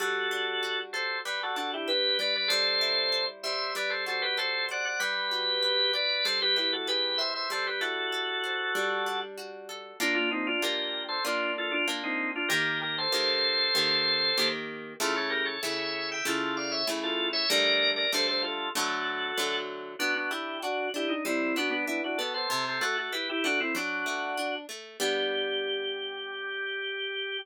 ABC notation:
X:1
M:4/4
L:1/16
Q:1/4=96
K:G
V:1 name="Drawbar Organ"
[FA]6 [Ac]2 [GB] [FA] [FA] [EG] [GB]2 [Bd] [Bd] | [Ac]6 [ce]2 [Bd] [Ac] [Ac] [GB] [Ac]2 [df] [df] | [GB]6 [Bd]2 [Ac] [GB] [GB] [FA] [GB]2 [ce] [ce] | [Ac] [GB] [FA]10 z4 |
[K:Gm] [B,D] [DF] [CE] [DF] [GB]3 [Ac] [DF]2 [FA] [DF] z [CE]2 [DF] | [GB]2 [GB] [Ac]11 z2 | [FA] [A^c] [GB] [Ac] [c=e]3 [eg] [FA]2 [df] [ce] z [FA]2 [ce] | [Bd]3 [Bd] [Ac] [Ac] [FA]2 [^FA]6 z2 |
[K:G] [DF] [DF] [EG]2 [DF]2 [EG] ^D [CE]2 [=DF] [B,D] [B,D] [DF] [FA] [Ac] | [Ac] [Ac] [FA] [FA] [GB] [EG] [DF] [CE] [DF]6 z2 | G16 |]
V:2 name="Orchestral Harp"
G,2 D2 F2 A2 G,2 D2 B2 G,2 | G,2 E2 c2 G,2 G,2 F2 A2 c2 | G,2 F2 B2 d2 G,2 E2 ^G2 B2 | G,2 E2 A2 c2 G,2 D2 F2 A2 |
[K:Gm] [B,DF]4 [B,DF]4 [B,DF]4 [B,DF]4 | [E,B,G]4 [E,B,G]4 [E,B,G]4 [E,B,G]4 | [^C,A,=E]4 [C,A,E]4 [C,A,E]4 [C,A,E]4 | [D,G,A,]4 [D,G,A,]4 [D,^F,A,]4 [D,F,A,]4 |
[K:G] B,2 D2 F2 D2 G,2 B,2 E2 B,2 | C,2 A,2 E2 A,2 F,2 A,2 D2 A,2 | [G,B,D]16 |]